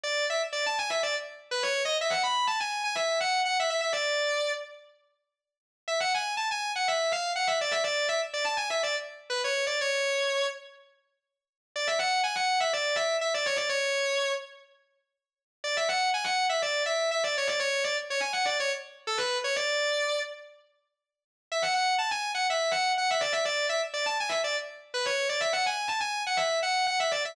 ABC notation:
X:1
M:4/4
L:1/16
Q:1/4=123
K:C#phr
V:1 name="Distortion Guitar"
d2 e z d a g e d z3 B c2 ^d | e f b2 a g2 g e2 f2 f e e e | d6 z10 | e f g2 a g2 f e2 ^e2 f =e d e |
d2 e z d a g e d z3 B c2 d | c6 z10 | d e f2 g f2 e d2 e2 e d c d | c6 z10 |
d e f2 g f2 e d2 e2 e d c d | c2 d z c g f d c z3 A B2 c | d6 z10 | e f f2 a g2 f e2 f2 f e d e |
d2 e z d a g e d z3 B c2 d | e f g2 a g2 f e2 f2 f e d e |]